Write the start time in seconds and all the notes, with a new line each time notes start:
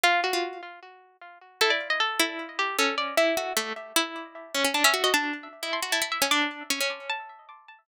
0.03 F4
0.24 F#4
0.33 F4
1.61 E4 A4
1.70 D5
1.90 D#5
2.00 A4
2.19 E4
2.59 G4
2.79 C#4 A4
2.98 D5
3.17 E4 E5
3.37 F#4
3.57 A3
3.96 E4
4.54 C#4
4.64 C#4
4.74 D4 A5
4.84 C#4 E5
4.94 F#4
5.04 F#4 D#5
5.14 D4 A5
5.63 E4
5.73 C6
5.82 F#4
5.92 E4 A5
6.02 E4
6.12 E5
6.22 C#4
6.31 D4 D6
6.70 C#4
6.80 C#4
7.09 A5